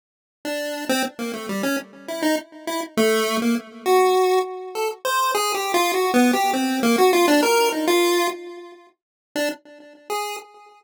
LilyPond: \new Staff { \time 6/4 \tempo 4 = 101 r8. d'8. c'16 r16 bes16 a16 g16 des'16 r8 e'16 ees'16 r8 e'16 r16 a8. bes16 | r8 ges'4 r8 a'16 r16 c''8 \tuplet 3/2 { aes'8 g'8 f'8 ges'8 b8 g'8 } c'8 bes16 ges'16 | f'16 d'16 bes'8 ees'16 f'8. r4. r16 d'16 r4 aes'8 r8 | }